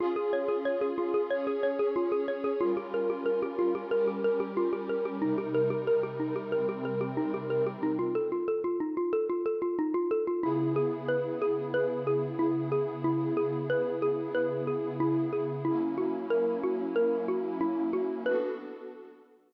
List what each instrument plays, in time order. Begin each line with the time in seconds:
0.00 pad 2 (warm) C#4 F4 G#4, xylophone F4
0.16 xylophone G#4
0.33 xylophone C#5
0.49 xylophone G#4
0.65 xylophone C#5
0.81 xylophone G#4
0.98 xylophone F4
1.14 xylophone G#4
1.30 pad 2 (warm) C#4 G#4 C#5, xylophone C#5
1.47 xylophone G#4
1.63 xylophone C#5
1.79 xylophone G#4
1.96 xylophone F4
2.12 xylophone G#4
2.28 xylophone C#5
2.44 xylophone G#4
2.60 pad 2 (warm) G3 C#4 F4 A#4, xylophone F4
2.77 xylophone G4
2.94 xylophone A#4
3.10 xylophone G4
3.26 xylophone A#4
3.43 xylophone G4
3.59 xylophone F4
3.75 xylophone G4
3.91 pad 2 (warm) G3 C#4 G4 A#4, xylophone A#4
4.07 xylophone G4
4.24 xylophone A#4
4.40 xylophone G4
4.57 xylophone F4
4.73 xylophone G4
4.89 xylophone A#4
5.05 xylophone G4
5.21 pad 2 (warm) C3 G3 D#4 A#4, xylophone D#4
5.38 xylophone G4
5.54 xylophone A#4
5.70 xylophone G4
5.87 xylophone A#4
6.03 xylophone G4
6.20 xylophone D#4
6.36 xylophone G4
6.52 pad 2 (warm) C3 G3 C4 A#4, xylophone A#4
6.69 xylophone G4
6.85 xylophone A#4
7.01 xylophone G4
7.17 xylophone D#4
7.34 xylophone G4
7.50 xylophone A#4
7.67 xylophone G4
7.83 xylophone D#4
7.99 xylophone F4
8.15 xylophone A4
8.32 xylophone F4
8.48 xylophone A4
8.64 xylophone F4
8.80 xylophone D#4
8.97 xylophone F4
9.13 xylophone A4
9.29 xylophone F4
9.46 xylophone A4
9.62 xylophone F4
9.79 xylophone D#4
9.94 xylophone F4
10.11 xylophone A4
10.27 xylophone F4
10.43 pad 2 (warm) C#3 B3 E4 G#4, xylophone E4
10.76 xylophone G#4
11.08 xylophone B4
11.42 xylophone G#4
11.74 xylophone B4
12.07 xylophone G#4
12.39 xylophone E4
12.72 xylophone G#4
13.04 xylophone E4
13.37 xylophone G#4
13.70 xylophone B4
14.02 xylophone G#4
14.35 xylophone B4
14.67 xylophone G#4
15.00 xylophone E4
15.33 xylophone G#4
15.65 pad 2 (warm) F#3 A#3 C#4 E4, xylophone E4
15.98 xylophone F#4
16.30 xylophone A#4
16.63 xylophone F#4
16.96 xylophone A#4
17.28 xylophone F#4
17.61 xylophone E4
17.93 xylophone F#4
18.26 pad 2 (warm) B3 D4 F#4 A4, xylophone B4